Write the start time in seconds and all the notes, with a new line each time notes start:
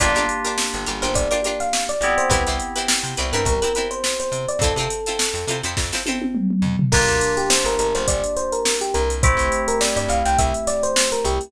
0.00 G1 A#3 D4 F4 G4 A#4 D5, kick, closed hi-hat
0.15 G1 D4 F4 G4 A#4, closed hi-hat
0.29 closed hi-hat
0.44 D4 F4 G4 A#4, closed hi-hat
0.58 snare
0.74 G1, closed hi-hat
0.86 G1 D4 F4 G4 A#4, closed hi-hat
1.02 G1 D4 F4 G4 A#4 C5, closed hi-hat
1.14 G1 D5, kick, closed hi-hat
1.31 D4 F4 G4 A#4 D5, closed hi-hat
1.44 D4 F4 G4 A#4, closed hi-hat
1.60 F5, snare, closed hi-hat
1.73 snare
1.89 D5, closed hi-hat
2.01 G1 B3 C4 E4 G4, closed hi-hat
2.18 C5, closed hi-hat
2.30 C2 C4 E4 G4 B4, kick, closed hi-hat
2.47 C2 C4 E4 G4 B4, snare, closed hi-hat
2.60 closed hi-hat
2.76 C4 E4 G4 B4, closed hi-hat
2.88 snare
3.03 C3, closed hi-hat
3.17 C2 C4 E4 G4 B4, closed hi-hat
3.33 G2 C4 E4 G4 A#4 B4, closed hi-hat
3.45 C2 A#4, kick, closed hi-hat
3.62 C4 E4 G4 A#4 B4, closed hi-hat
3.75 C4 E4 G4 B4, closed hi-hat
3.91 C5, closed hi-hat
4.04 snare
4.20 C5, closed hi-hat
4.32 C3, closed hi-hat
4.48 D5, closed hi-hat
4.59 F2 F4 A4, kick, closed hi-hat
4.63 C4 E4
4.76 C3 E4 F4 A4, closed hi-hat
4.80 C4
4.90 closed hi-hat
5.06 C4 E4 F4 A4, snare, closed hi-hat
5.19 snare
5.34 F2, snare, closed hi-hat
5.47 C3 C4 E4 F4 A4, closed hi-hat
5.63 F2 C4 E4 F4 A4, closed hi-hat
5.77 F2, kick, snare
5.92 C4 E4 F4 A4, snare
6.06 C4 E4 F4 A4, high tom
6.22 high tom
6.35 mid tom
6.50 mid tom
6.62 F2, floor tom
6.79 floor tom
6.92 G1 A#3 D4 F4 G4 A#4, kick, crash
7.08 D2, closed hi-hat
7.21 closed hi-hat
7.37 G4, closed hi-hat
7.50 C5, snare
7.64 G1 A#4, snare, closed hi-hat
7.79 G1 A#4, closed hi-hat
7.95 G1 C5, snare, closed hi-hat
8.08 G1 D5, kick, closed hi-hat
8.24 closed hi-hat
8.37 C5, closed hi-hat
8.52 A#4, closed hi-hat
8.65 snare
8.81 G4, closed hi-hat
8.94 C2 A#4, closed hi-hat
9.10 closed hi-hat
9.23 A3 C4 E4 G4 C5, kick, closed hi-hat
9.37 C2, closed hi-hat
9.52 closed hi-hat
9.68 A#4, closed hi-hat
9.81 D5, snare
9.96 G2 D5, closed hi-hat
10.08 C2 F5, closed hi-hat
10.25 C2 G5, closed hi-hat
10.38 C2 E5, kick, closed hi-hat
10.54 closed hi-hat
10.67 D5, snare, closed hi-hat
10.83 C5, closed hi-hat
10.96 snare
11.12 A#4, closed hi-hat
11.25 C2 G4, closed hi-hat
11.41 closed hi-hat